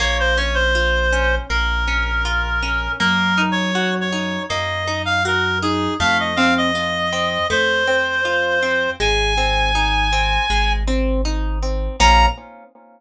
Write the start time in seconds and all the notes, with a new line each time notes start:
0.00 A#1 A#3 C#5
0.20 C5
0.37 C#4 C#5
0.54 C5
0.75 F4
1.12 C#4
1.49 A#1 A#3 A#4
1.88 C#4
2.25 F4
2.62 C#4
3.00 F#2 A#3 A#4
3.38 D#4
3.52 C#5
3.75 F#4
4.01 C#5
4.12 D#4
4.49 F#2 A#3 D#5
4.88 D#4
5.05 F5
5.25 F#4 A#4
5.62 D#4 G#4
6.00 F2 A3 F5
6.20 D#5
6.36 C4 F5
6.58 D#5
6.75 F4
7.12 C4
7.50 F2 A3 C5
7.88 C4
8.25 F4
8.62 C4
9.00 G#1 G#3 G#5
9.38 C4
9.75 D#4
10.12 C4
10.50 G#1 G#3
10.88 C4
11.25 D#4
11.62 C4
12.00 A#1 A#3 C#4 F4 A#5